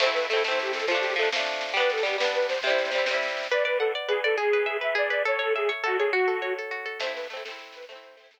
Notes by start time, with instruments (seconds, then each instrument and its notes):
0.00 orchestral harp A3 C4, accordion C5, kick, snare, crash
0.06 orchestral harp E4, snare
0.14 accordion B4, snare
0.23 snare
0.29 orchestral harp A3, accordion A4, snare
0.33 orchestral harp C4 E4
0.38 snare
0.44 orchestral harp A3 C4, accordion C5, snare
0.51 orchestral harp E4, snare
0.58 accordion G4, snare
0.65 snare
0.73 accordion A4, snare
0.79 snare
0.87 orchestral harp F3, accordion F4, kick, snare
0.91 orchestral harp A3 D4
0.96 snare
1.01 accordion G4, snare
1.10 snare
1.16 orchestral harp F3 A3, accordion A4, snare
1.22 orchestral harp D4, snare
1.32 orchestral harp F3 A3, snare
1.38 orchestral harp D4, snare
1.45 snare
1.53 snare
1.61 snare
1.68 snare
1.73 orchestral harp G3 B3, accordion B4, kick, snare
1.80 orchestral harp D4, snare
1.89 accordion A4, snare
1.97 snare
2.03 orchestral harp G3 B3, accordion G4, snare
2.09 orchestral harp D4, snare
2.18 orchestral harp G3 B3, accordion B4, snare
2.24 orchestral harp D4, snare
2.34 accordion B4, snare
2.42 snare
2.48 accordion C5, snare
2.54 snare
2.62 orchestral harp C3, accordion C5, kick, snare
2.67 orchestral harp G3 E4, snare
2.78 snare
2.85 snare
2.91 orchestral harp C3 G3, snare
2.98 orchestral harp E4, snare
3.06 orchestral harp C3, snare
3.10 orchestral harp G3 E4, snare
3.22 snare
3.28 snare
3.37 snare
3.43 snare
3.50 orchestral harp B4, accordion D5
3.64 accordion B4, orchestral harp D5
3.79 accordion A4, orchestral harp F#5
3.95 orchestral harp D5
4.08 accordion G#4, orchestral harp B4
4.24 accordion A4, orchestral harp D5
4.37 orchestral harp G#4, accordion G#4
4.53 orchestral harp B4
4.66 orchestral harp E5
4.81 orchestral harp B4, accordion E5
4.95 orchestral harp G#4, accordion D5
5.09 orchestral harp B4, accordion D5
5.25 orchestral harp A4, accordion C#5
5.39 accordion A4, orchestral harp C#5
5.55 accordion G#4, orchestral harp E5
5.69 orchestral harp C#5
5.83 accordion F#4, orchestral harp A4
5.98 accordion G#4, orchestral harp C#5
6.13 accordion F#4, orchestral harp F#4
6.28 orchestral harp A4
6.42 orchestral harp C#5
6.58 orchestral harp A4
6.71 orchestral harp F#4
6.85 orchestral harp A4
7.00 orchestral harp A3 C4, accordion C5, kick, snare, crash
7.07 orchestral harp E4, snare
7.15 accordion B4, snare
7.23 snare
7.30 orchestral harp A3 C4, accordion A4, snare
7.37 orchestral harp E4, snare
7.43 orchestral harp A3, accordion A4, snare
7.48 orchestral harp C4 E4, snare
7.59 snare
7.66 snare
7.72 accordion B4, snare
7.82 snare
7.89 orchestral harp A3 C4, accordion C5, kick, snare
7.95 orchestral harp E4, snare
8.03 snare
8.11 snare
8.17 orchestral harp A3 C4, snare
8.23 orchestral harp E4, snare
8.31 orchestral harp A3, snare
8.37 orchestral harp C4